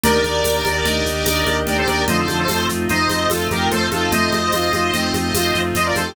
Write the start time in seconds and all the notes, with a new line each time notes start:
0.03 D#2 A#3 D4 D#4 G4 A#4 D5, low conga, shaker
0.23 D#2 A#3 D4 D#4 G4 D5, high conga, shaker
0.44 D#2 A#3 D4 D#4 G4, tambourine, high conga, shaker
0.65 D#2 A#3 D4 D#4 G4, high conga, shaker
0.85 D#2 A#3 D4 D#4 G4 D#5, low conga, shaker
1.05 D#2 A#3 D4 D#4 G4, shaker
1.25 D#2 A#3 D4 D#4 G4 D#5, tambourine, high conga, shaker
1.46 D#2 A#3 D4 D#4 G4, high conga, shaker
1.66 D#2 G4 A#4 D5, low conga, shaker
1.78 A4 C5
1.87 D#2 A#3 D4 D#4 G4 A#4 D5, high conga, shaker
2.08 F2 D3 F3 A3 C4 D#4 F4 C5 D#5, low conga, shaker
2.18 A4 C5
2.27 F2 A3 C4 D#4 F4, high conga, shaker
2.39 A4 C5
2.48 F2 A3 C4 D#4 F4, tambourine, high conga, shaker
2.68 F2 A3 C4 D#4 F4, shaker
2.88 F2 A3 C4 D#4 F4 C5 D#5, low conga, shaker
3.10 F2 A3 C4 D#4 F4, high conga, shaker
3.30 F2 A3 C4 D#4 F4 A4, tambourine, high conga, shaker
3.51 F2 A3 C4 D#4 F4 G4 A#4, high conga, shaker
3.71 F2 A4 C5, low conga, shaker
3.91 F2 A3 C4 D#4 F4 A4, high conga, shaker
4.11 F2 A3 C4 D#4 F4 C5 D#5, low conga, shaker
4.32 F2 A3 C4 D#4 F4, high conga, shaker
4.52 F2 A3 C4 D#4 F4, tambourine, high conga, shaker
4.71 F2 A3 C4 D#4 F4, high conga, shaker
4.94 F2 A3 C4 D#4 F4, low conga, shaker
5.14 F2 A3 C4 D#4 F4, high conga, shaker
5.34 F2 A3 C4 D#4 F4, tambourine, high conga, shaker
5.54 F2 A3 C4 D#4 F4, shaker
5.75 F2 C5 D#5, low conga, shaker
5.85 F4 A#4 D5
5.95 F2 A3 C4 D#4 F4 A4 C5, high conga, shaker
6.06 G4